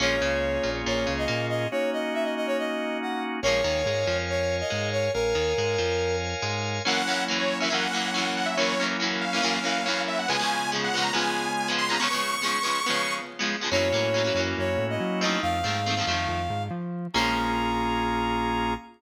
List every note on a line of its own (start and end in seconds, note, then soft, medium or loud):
0.00 0.19 A#1 loud
0.00 0.16 F3 medium
0.00 0.16 G#3 medium
0.00 1.67 A#3 medium
0.00 0.16 A#3 medium
0.00 0.16 C#4 loud
0.00 1.67 C#4 medium
0.00 1.67 F4 medium
0.00 1.67 G#4 medium
0.00 0.70 C#5 medium
0.21 0.58 C#2 loud
0.21 0.58 C#3 medium
0.63 0.83 A#1 medium
0.63 0.82 A#2 medium
0.86 1.05 A#1 medium
0.86 1.04 A#2 medium
0.86 1.13 C#5 medium
1.07 1.26 C#2 medium
1.07 1.25 C#3 medium
1.18 1.46 D#5 medium
1.28 1.66 A#2 medium
1.28 1.64 A#3 medium
1.49 1.68 D#5 medium
1.71 3.40 A#3 medium
1.71 3.40 C#4 medium
1.71 3.40 D#4 medium
1.71 3.40 F#4 medium
1.71 1.90 C#5 medium
1.93 2.14 D#5 medium
2.14 2.24 E5 medium
2.24 2.34 D#5 medium
2.36 2.47 D#5 medium
2.47 2.57 C#5 medium
2.59 2.97 D#5 medium
3.02 3.23 F#5 medium
3.42 3.61 A#1 loud
3.42 3.61 A#3 medium
3.42 3.61 C#4 medium
3.42 5.11 A#4 medium
3.42 4.17 C#5 loud
3.42 5.11 C#5 medium
3.42 5.11 F5 medium
3.42 5.11 G#5 medium
3.47 3.61 F3 medium
3.47 3.61 G#3 medium
3.64 3.82 D#2 loud
3.64 3.82 D#3 medium
3.86 4.04 G#2 medium
3.86 4.05 G#3 medium
4.07 4.62 F2 medium
4.07 4.62 F3 medium
4.29 4.56 C#5 medium
4.60 4.89 D#5 medium
4.70 5.08 G#2 medium
4.70 5.07 G#3 medium
4.92 5.12 C#5 medium
5.14 5.33 A#1 loud
5.14 6.16 A#4 medium
5.14 6.82 A#4 medium
5.14 6.82 C#5 medium
5.14 6.82 F5 medium
5.14 6.82 G#5 medium
5.35 5.53 D#2 medium
5.35 5.53 D#3 medium
5.58 5.76 G#2 medium
5.58 5.76 G#3 medium
5.78 6.34 F2 medium
5.78 6.33 F3 medium
6.42 6.79 G#2 loud
6.42 6.79 G#3 medium
6.85 7.02 F#2 medium
6.85 7.02 E3 medium
6.85 7.70 F#3 medium
6.85 7.70 A#3 medium
6.85 7.02 A#3 medium
6.85 7.02 C#4 medium
6.85 7.70 C#4 medium
6.85 7.70 E4 medium
6.85 7.24 F#5 medium
7.07 7.24 F#2 medium
7.07 7.24 E3 medium
7.07 7.24 A#3 medium
7.07 7.24 C#4 medium
7.28 7.54 F#2 medium
7.28 7.54 E3 medium
7.28 7.54 A#3 medium
7.28 7.54 C#4 medium
7.39 7.58 C#5 medium
7.60 7.69 F#2 medium
7.60 7.69 E3 medium
7.60 7.69 A#3 medium
7.60 7.69 C#4 medium
7.60 7.72 E5 medium
7.70 7.87 F#2 medium
7.70 7.87 E3 medium
7.70 8.56 F#3 medium
7.70 7.87 A#3 medium
7.70 8.56 A#3 medium
7.70 7.87 C#4 medium
7.70 8.56 C#4 medium
7.70 8.56 E4 medium
7.70 8.34 F#5 medium
7.93 8.10 F#2 medium
7.93 8.10 E3 medium
7.93 8.10 A#3 medium
7.93 8.10 C#4 medium
8.14 8.48 F#2 medium
8.14 8.48 E3 medium
8.14 8.48 A#3 medium
8.14 8.48 C#4 medium
8.37 8.47 F#5 medium
8.46 8.56 E5 medium
8.57 8.75 E3 medium
8.57 9.41 F#3 medium
8.57 9.41 A#3 medium
8.57 8.75 A#3 medium
8.57 9.41 C#4 medium
8.57 8.75 C#4 medium
8.57 9.41 E4 medium
8.57 8.85 C#5 medium
8.61 8.75 F#2 loud
8.80 8.97 F#2 medium
8.80 8.97 E3 medium
8.80 8.97 A#3 medium
8.80 8.97 C#4 medium
9.00 9.25 F#2 medium
9.00 9.25 E3 medium
9.00 9.25 A#3 medium
9.00 9.25 C#4 medium
9.21 10.02 F5 medium
9.33 9.42 F#2 medium
9.33 9.42 E3 medium
9.33 9.42 A#3 medium
9.33 9.41 C#4 medium
9.42 9.59 F#2 medium
9.42 9.59 E3 loud
9.42 10.26 F#3 medium
9.42 10.26 A#3 medium
9.42 9.59 A#3 loud
9.42 9.59 C#4 loud
9.42 10.26 C#4 medium
9.42 10.26 E4 medium
9.64 9.81 F#2 medium
9.64 9.81 E3 medium
9.64 9.81 A#3 medium
9.64 9.81 C#4 medium
9.86 10.20 F#2 medium
9.86 10.20 E3 medium
9.86 10.20 A#3 medium
9.86 10.20 C#4 medium
10.08 10.18 E5 medium
10.19 10.29 F#5 medium
10.28 11.13 C#3 medium
10.28 10.37 C#3 medium
10.28 10.37 F3 medium
10.28 11.13 G#3 medium
10.28 10.37 G#3 loud
10.28 10.37 B3 medium
10.28 11.13 B3 medium
10.28 11.13 F4 medium
10.28 10.70 G#5 medium
10.39 10.65 C#3 medium
10.39 10.65 F3 medium
10.39 10.65 G#3 medium
10.39 10.65 B3 medium
10.72 10.89 C#3 medium
10.72 10.89 F3 medium
10.72 10.89 G#3 medium
10.72 10.89 B3 medium
10.84 11.03 F#5 medium
10.94 11.11 C#3 medium
10.94 11.11 F3 medium
10.94 11.11 G#3 medium
10.94 11.11 B3 medium
11.02 11.12 A#5 medium
11.13 11.99 C#3 medium
11.13 11.47 C#3 medium
11.13 11.47 F3 medium
11.13 11.47 G#3 medium
11.13 11.99 G#3 medium
11.13 11.47 B3 medium
11.13 11.99 B3 medium
11.13 11.99 F4 medium
11.13 11.70 G#5 medium
11.68 11.85 C#3 medium
11.68 11.85 F3 medium
11.68 11.85 G#3 medium
11.68 11.85 B3 medium
11.78 11.88 C6 medium
11.89 11.97 C#3 medium
11.89 11.97 F3 medium
11.89 11.97 G#3 medium
11.89 11.97 B3 medium
11.89 12.00 A#5 medium
12.00 12.08 C#3 medium
12.00 12.08 F3 loud
12.00 12.08 G#3 loud
12.00 12.08 B3 medium
12.00 13.13 C#6 medium
12.10 12.36 C#3 medium
12.10 12.36 F3 medium
12.10 12.36 G#3 medium
12.10 12.36 B3 medium
12.42 12.59 C#3 medium
12.42 12.59 F3 medium
12.42 12.59 G#3 medium
12.42 12.59 B3 medium
12.63 12.80 C#3 medium
12.63 12.80 F3 medium
12.63 12.80 G#3 medium
12.63 12.80 B3 medium
12.86 13.21 C#3 medium
12.86 13.21 F3 medium
12.86 13.21 G#3 medium
12.86 13.21 B3 medium
13.39 13.56 C#3 medium
13.39 13.56 F3 medium
13.39 13.56 G#3 medium
13.39 13.56 B3 medium
13.61 13.70 C#3 medium
13.61 13.70 F3 medium
13.61 13.70 G#3 medium
13.61 13.70 B3 medium
13.71 13.90 F#2 loud
13.71 13.89 F#3 medium
13.71 15.40 A#3 medium
13.71 13.89 A#3 medium
13.71 13.89 C#4 medium
13.71 15.40 C#4 medium
13.71 15.40 E4 medium
13.71 15.40 F#4 medium
13.71 14.40 C#5 loud
13.75 13.89 E3 medium
13.92 14.29 A2 medium
13.92 14.10 E3 medium
13.92 14.10 F#3 medium
13.92 14.10 A#3 medium
13.92 14.10 C#4 medium
14.14 14.23 E3 medium
14.14 14.23 F#3 medium
14.14 14.23 A#3 medium
14.14 14.23 C#4 medium
14.24 14.33 E3 medium
14.24 14.33 F#3 medium
14.24 14.33 A#3 medium
14.24 14.33 C#4 medium
14.35 14.53 F#2 medium
14.35 14.70 F#3 medium
14.35 14.70 A#3 medium
14.35 14.70 C#4 medium
14.39 14.70 E3 medium
14.58 14.76 F#2 medium
14.58 14.85 C#5 medium
14.78 14.96 A2 loud
14.90 15.20 D#5 medium
15.00 15.37 F#3 medium
15.20 15.60 F3 medium
15.20 15.60 A3 medium
15.20 15.60 C4 medium
15.20 15.40 D#5 medium
15.25 15.60 D#3 medium
15.42 15.62 F2 medium
15.42 16.63 F5 loud
15.64 16.01 G#2 medium
15.64 15.81 D#3 medium
15.64 15.81 F3 medium
15.64 15.81 A3 medium
15.64 15.81 C4 medium
15.86 15.95 D#3 medium
15.86 15.95 F3 medium
15.86 15.95 A3 medium
15.86 15.95 C4 medium
15.97 16.06 D#3 medium
15.97 16.06 F3 medium
15.97 16.06 A3 medium
15.97 16.06 C4 medium
16.07 16.26 F2 medium
16.07 16.41 D#3 medium
16.07 16.41 F3 medium
16.07 16.41 A3 medium
16.07 16.41 C4 medium
16.29 16.47 F2 medium
16.50 16.68 G#2 medium
16.71 17.07 F3 medium
17.14 18.74 A#1 loud
17.14 18.74 G#3 medium
17.14 18.74 A#3 loud
17.14 18.74 C#4 medium
17.14 18.74 F4 medium
17.14 18.74 G#4 medium
17.14 18.73 A#5 loud
17.18 18.74 F3 medium